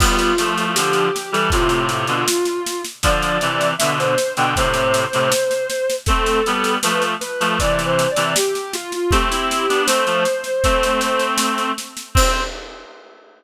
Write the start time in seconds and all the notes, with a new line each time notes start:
0.00 G3 B3 F4, kick, snare, crash
0.19 snare
0.38 F3 A3, snare
0.58 snare
0.75 D3 F3 G4, snare
0.93 G4, snare
1.16 snare
1.32 E3 G3 A4, snare
1.50 A2 C3 F4, kick, snare
1.69 snare
1.89 snare
2.07 B2 D3, snare
2.28 snare
2.45 snare
2.66 snare
2.84 snare
3.03 D3 F3 D5, kick, snare
3.22 snare
3.41 C3 E3, snare
3.61 snare
3.78 B2 D3 E5, snare
3.99 C5, snare
4.18 snare
4.37 B2 D3 G5, snare
4.56 A2 C3 C5, kick, snare
4.74 snare
4.94 snare
5.13 A2 C3, snare
5.32 snare
5.51 snare
5.70 snare
5.90 snare
6.06 A3 C4 A4, kick, snare
6.26 snare
6.46 G3 B3, snare
6.64 snare
6.83 F3 A3 B4, snare
7.02 snare
7.21 B4, snare
7.40 F3 A3, snare
7.59 C3 E3 D5, kick, snare
7.79 snare
7.85 C5
7.99 snare
8.11 D5
8.16 C3 E3, snare
8.36 G4, snare
8.55 snare
8.72 F4, snare
8.92 F4, snare
9.10 A3 C4 G4, kick, snare
9.30 C4 E4, snare
9.51 snare
9.69 B3 D4, snare
9.87 A3 C4 C5, snare
10.06 F3 A3, snare
10.25 snare
10.44 snare
10.64 A3 C4, kick, snare
10.83 snare
11.01 snare
11.19 snare
11.38 snare
11.58 snare
11.78 snare
11.97 snare
12.15 C4 C5, kick, crash